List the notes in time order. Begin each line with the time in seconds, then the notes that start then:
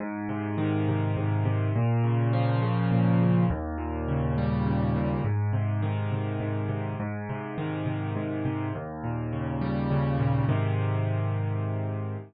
0.00 G#2
0.29 C3
0.58 D#3
0.89 C3
1.17 G#2
1.45 C3
1.76 A#2
2.04 C#3
2.33 F3
2.62 C#3
2.92 A#2
3.21 C#3
3.50 D#2
3.78 A#2
4.08 C#3
4.38 G3
4.67 C#3
4.96 A#2
5.24 G#2
5.53 C3
5.82 D#3
6.12 C3
6.40 G#2
6.69 C3
7.00 G#2
7.29 C3
7.58 D#3
7.86 C3
8.16 G#2
8.45 C3
8.75 D#2
9.04 A#2
9.33 C#3
9.61 G3
9.91 C#3
10.19 A#2
10.49 G#2 C3 D#3